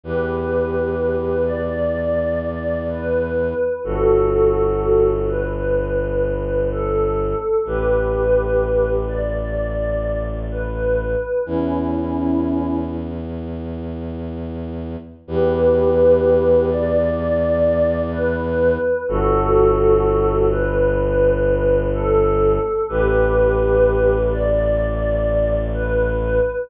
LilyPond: <<
  \new Staff \with { instrumentName = "Pad 5 (bowed)" } { \time 4/4 \key e \dorian \tempo 4 = 63 <g' b'>4. d''4. b'4 | <fis' a'>4. b'4. a'4 | <g' b'>4. d''4. b'4 | <cis' e'>4. r2 r8 |
<g' b'>4. d''4. b'4 | <fis' a'>4. b'4. a'4 | <g' b'>4. d''4. b'4 | }
  \new Staff \with { instrumentName = "Violin" } { \clef bass \time 4/4 \key e \dorian e,1 | g,,1 | a,,1 | e,1 |
e,1 | g,,1 | a,,1 | }
>>